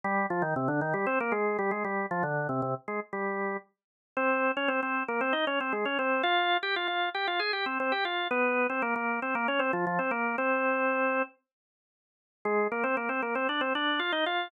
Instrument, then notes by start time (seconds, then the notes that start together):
drawbar organ
0.04 G3 G4
0.30 F3 F4
0.42 D#3 D#4
0.56 C3 C4
0.68 D3 D4
0.81 D#3 D#4
0.94 G3 G4
1.06 C4 C5
1.20 A#3 A#4
1.32 G#3 G#4
1.59 G3 G4
1.71 G#3 G#4
1.84 G3 G4
2.11 F3 F4
2.23 D3 D4
2.49 C3 C4
2.62 C3 C4
2.88 G#3 G#4
3.13 G3 G4
4.17 C4 C5
4.57 C#4 C#5
4.68 C4 C5
4.83 C4 C5
5.08 A#3 A#4
5.21 C4 C5
5.33 D#4 D#5
5.47 C#4 C#5
5.60 C4 C5
5.73 G#3 G#4
5.85 C#4 C#5
5.99 C4 C5
6.23 F4 F5
6.63 G4 G5
6.76 F4 F5
6.88 F4 F5
7.14 G4 G5
7.27 F4 F5
7.39 G#4 G#5
7.53 G4 G5
7.66 C4 C5
7.80 C4 C5
7.92 G4 G5
8.05 F4 F5
8.31 B3 B4
8.70 C4 C5
8.82 A#3 A#4
8.96 A#3 A#4
9.22 C4 C5
9.35 A#3 A#4
9.48 C#4 C#5
9.59 C4 C5
9.73 F3 F4
9.87 F3 F4
9.99 C4 C5
10.11 A#3 A#4
10.38 C4 C5
12.45 G#3 G#4
12.72 A#3 A#4
12.84 C4 C5
12.97 A#3 A#4
13.09 C4 C5
13.22 A#3 A#4
13.35 C4 C5
13.49 D4 D5
13.61 C4 C5
13.75 D4 D5
13.99 F4 F5
14.12 D#4 D#5
14.26 F4 F5